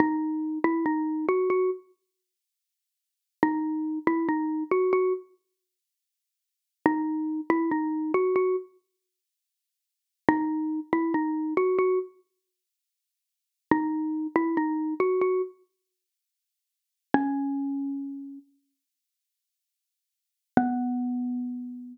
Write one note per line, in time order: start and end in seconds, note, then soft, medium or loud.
0.00 0.59 D#4 medium
0.64 0.85 E4 medium
0.86 1.26 D#4 medium
1.29 1.49 F#4 medium
1.50 1.70 F#4 medium
3.43 3.99 D#4 medium
4.07 4.28 E4 medium
4.29 4.64 D#4 medium
4.71 4.92 F#4 medium
4.93 5.13 F#4 medium
6.86 7.41 D#4 medium
7.50 7.70 E4 medium
7.71 8.12 D#4 medium
8.14 8.35 F#4 medium
8.36 8.56 F#4 medium
10.29 10.80 D#4 loud
10.93 11.13 E4 medium
11.14 11.54 D#4 medium
11.57 11.78 F#4 medium
11.79 11.99 F#4 medium
13.71 14.27 D#4 medium
14.36 14.56 E4 medium
14.57 14.94 D#4 medium
15.00 15.20 F#4 medium
15.21 15.42 F#4 medium
17.14 18.39 C#4 medium
20.57 21.98 B3 loud